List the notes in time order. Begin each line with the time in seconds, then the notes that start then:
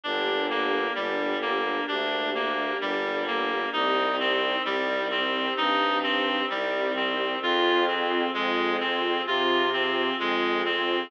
0.03 G1 A#3 D4 G4
0.50 A#3
0.95 G1 G3
1.42 A#3
1.88 D2 D4
2.35 A#3
2.81 G1 G3
3.27 A#3
3.72 C2 C4 D#4 G4
4.20 C4
4.64 C2 G3
5.11 C4
5.57 G2 D#4
6.03 C4
6.50 C2 G3
6.96 C4
7.41 F2 C4 F4 G#4
7.88 C4
8.34 F2 G#3
8.80 C4
9.26 C3 F4
9.73 C4
10.20 F2 G#3
10.65 C4